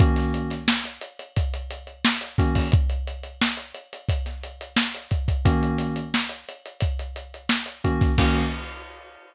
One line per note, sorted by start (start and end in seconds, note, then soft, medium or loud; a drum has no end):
0.00 0.54 D#3 medium
0.00 0.54 A#3 medium
0.00 0.54 C#4 medium
0.00 0.54 F#4 medium
0.00 kick loud
0.00 closed hi-hat loud
0.16 snare medium
0.16 closed hi-hat medium
0.34 closed hi-hat medium
0.50 snare soft
0.50 closed hi-hat medium
0.68 snare loud
0.84 snare soft
0.84 closed hi-hat medium
1.01 closed hi-hat loud
1.19 closed hi-hat medium
1.36 kick loud
1.36 closed hi-hat loud
1.54 closed hi-hat medium
1.71 closed hi-hat loud
1.87 closed hi-hat medium
2.05 snare loud
2.21 closed hi-hat medium
2.38 2.66 D#3 medium
2.38 2.66 A#3 medium
2.38 2.66 C#4 medium
2.38 2.66 F#4 medium
2.38 kick loud
2.38 snare soft
2.38 closed hi-hat loud
2.55 kick loud
2.55 open hi-hat medium
2.72 kick loud
2.72 closed hi-hat loud
2.90 closed hi-hat medium
3.07 closed hi-hat loud
3.23 closed hi-hat medium
3.41 snare loud
3.57 closed hi-hat medium
3.74 closed hi-hat medium
3.93 closed hi-hat medium
4.09 kick loud
4.09 closed hi-hat loud
4.26 snare soft
4.26 closed hi-hat medium
4.43 closed hi-hat medium
4.61 closed hi-hat loud
4.76 snare loud
4.94 closed hi-hat medium
5.11 kick loud
5.11 closed hi-hat medium
5.28 kick loud
5.28 closed hi-hat medium
5.45 6.00 D#3 loud
5.45 6.00 A#3 loud
5.45 6.00 C#4 loud
5.45 6.00 F#4 medium
5.45 kick loud
5.45 closed hi-hat loud
5.63 closed hi-hat medium
5.78 snare soft
5.78 closed hi-hat loud
5.96 closed hi-hat medium
6.14 snare loud
6.29 closed hi-hat medium
6.49 closed hi-hat loud
6.66 closed hi-hat medium
6.81 kick loud
6.81 closed hi-hat loud
6.99 closed hi-hat medium
7.16 closed hi-hat loud
7.34 closed hi-hat medium
7.49 snare loud
7.66 closed hi-hat medium
7.84 8.11 D#3 medium
7.84 8.11 A#3 medium
7.84 8.11 C#4 medium
7.84 8.11 F#4 medium
7.84 kick medium
7.84 closed hi-hat medium
8.01 kick loud
8.01 snare soft
8.01 closed hi-hat medium
8.18 8.42 D#3 loud
8.18 8.42 A#3 loud
8.18 8.42 C#4 loud
8.18 8.42 F#4 medium
8.18 kick loud
8.18 crash loud